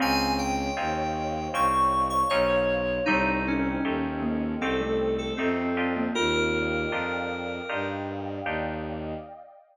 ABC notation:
X:1
M:4/4
L:1/16
Q:1/4=78
K:Ebmix
V:1 name="Electric Piano 2"
a2 g6 d'3 d' d4 | E2 D6 =A3 A C4 | B10 z6 |]
V:2 name="Glockenspiel"
C4 z12 | G,6 B,2 C =A,3 z3 B, | F4 z12 |]
V:3 name="Orchestral Harp"
[CDEF]4 [CDEF]4 [CDEF]4 [CDEF]4 | [=A,CEG]4 [A,CEG]4 [A,CEG]4 [A,CEG]2 [=DEFG]2- | [=DEFG]4 [DEFG]4 [DEFG]4 [DEFG]4 |]
V:4 name="Violin" clef=bass
D,,4 E,,4 C,,4 =B,,,4 | C,,4 E,,4 C,,4 F,,4 | E,,4 F,,4 G,,4 E,,4 |]
V:5 name="Pad 2 (warm)"
[cdef]16 | [=Aceg]16 | [=defg]16 |]